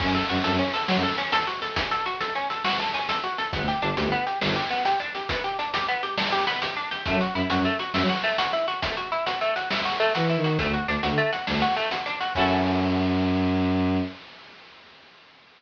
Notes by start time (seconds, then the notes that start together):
0.00 F#2 C#4, kick, crash
0.08 F#2
0.15 A4, closed hi-hat
0.29 F#2 F#4, closed hi-hat
0.44 F#2 A4, closed hi-hat
0.51 F#2
0.59 C#4, closed hi-hat
0.74 A4, closed hi-hat
0.88 F#3 F#4, snare
0.95 F#2
1.03 A4, closed hi-hat
1.18 C#4, closed hi-hat
1.32 A4, closed hi-hat
1.47 F#4, closed hi-hat
1.62 A4, closed hi-hat
1.76 C#4, kick, closed hi-hat
1.91 A4, closed hi-hat
2.06 F#4, closed hi-hat
2.21 A4, closed hi-hat
2.35 C#4, closed hi-hat
2.50 A4, closed hi-hat
2.64 F#4, snare
2.79 A4, closed hi-hat
2.94 C#4, closed hi-hat
3.09 A4, closed hi-hat
3.23 F#4, closed hi-hat
3.38 A4, closed hi-hat
3.53 G1 B3, kick, closed hi-hat
3.60 D2
3.68 G4, closed hi-hat
3.81 G1 D4, closed hi-hat
3.97 D2 G4, closed hi-hat
4.04 G1
4.12 B3, closed hi-hat
4.27 G4, closed hi-hat
4.41 G1 D4, snare
4.48 G1
4.56 G4, closed hi-hat
4.71 B3, closed hi-hat
4.85 G4, closed hi-hat
5.00 D4, closed hi-hat
5.15 G4, closed hi-hat
5.29 B3, kick, closed hi-hat
5.44 G4, closed hi-hat
5.59 D4, closed hi-hat
5.74 G4, closed hi-hat
5.88 B3, closed hi-hat
6.03 G4, closed hi-hat
6.18 D4, snare
6.32 G4, closed hi-hat
6.47 B3, closed hi-hat
6.62 G4, closed hi-hat
6.77 D4, closed hi-hat
6.91 G4, closed hi-hat
7.06 F#2 A3, kick, closed hi-hat
7.13 F#3
7.21 F#4, closed hi-hat
7.34 F#2 E4, closed hi-hat
7.50 F#2 F#4, closed hi-hat
7.58 F#2
7.65 A3, closed hi-hat
7.79 F#4, closed hi-hat
7.93 F#2 E4, snare
8.01 F#3
8.09 F#4, closed hi-hat
8.23 A3, closed hi-hat
8.38 F#4, closed hi-hat
8.53 E4, closed hi-hat
8.68 F#4, closed hi-hat
8.82 A3, kick, closed hi-hat
8.97 F#4, closed hi-hat
9.12 E4, closed hi-hat
9.26 F#4, closed hi-hat
9.41 A3, closed hi-hat
9.56 F#4, closed hi-hat
9.70 E4, snare
9.85 F#4, closed hi-hat
10.00 A3, closed hi-hat
10.15 E3 F#4, closed hi-hat
10.29 E4, closed hi-hat
10.37 D#3
10.44 F#4, closed hi-hat
10.59 D2 A3, kick, closed hi-hat
10.67 D2
10.74 F#4, closed hi-hat
10.87 D2 D4, closed hi-hat
11.03 D2 F#4, closed hi-hat
11.11 D3
11.18 A3, closed hi-hat
11.32 F#4, closed hi-hat
11.47 D2 D4, snare
11.54 D2
11.62 F#4, closed hi-hat
11.76 A3, closed hi-hat
11.91 F#4, closed hi-hat
12.06 D4, closed hi-hat
12.20 F#4, closed hi-hat
12.35 F#2 C#4 E4 F#4 A4, kick, crash